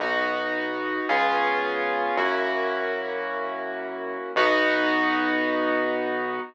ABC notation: X:1
M:4/4
L:1/8
Q:1/4=110
K:B
V:1 name="Acoustic Grand Piano"
[B,DF]4 [B,C^EG]4 | [A,CEF]8 | [B,DF]8 |]
V:2 name="Synth Bass 1" clef=bass
B,,,4 C,,4 | F,,8 | B,,,8 |]